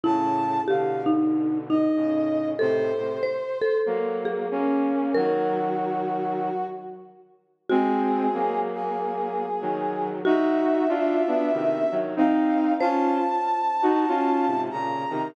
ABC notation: X:1
M:4/4
L:1/8
Q:"Swing" 1/4=94
K:Db
V:1 name="Brass Section"
=a2 f z2 e3 | c4 z4 | G5 z3 | A3 A5 |
_f6 =f2 | =a6 b2 |]
V:2 name="Marimba"
_F2 =G E2 E3 | =A2 c A2 _A3 | B5 z3 | G8 |
G8 | c8 |]
V:3 name="Flute"
[=A,,D,]2 [=B,,=D,]4 [A,,_D,]2 | [=A,,C,] [A,,C,] z2 [G,B,]2 [B,D]2 | [E,G,]5 z3 | [A,C]2 [G,B,]4 [E,G,]2 |
[EG]2 [=DF] [=B,D] [C,E,] [E,G,] [CE]2 | [DF] z2 [EG] [DF] [A,,C,] [B,,D,] [C,E,] |]